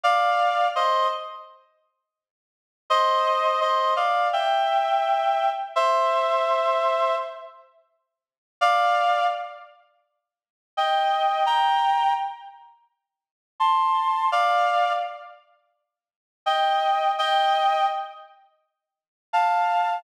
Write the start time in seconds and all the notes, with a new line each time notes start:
0.04 D5 F5
0.76 C5 D#5
2.90 C5 D#5
3.61 C5 D#5
3.96 D5 F5
4.33 E5 G5
5.76 C5 E5
8.61 D5 F5
10.77 D#5 G5
11.46 G5 A#5
13.60 A5 C6
14.32 D5 F5
16.46 D#5 G5
17.18 D#5 G5
19.33 F5 A5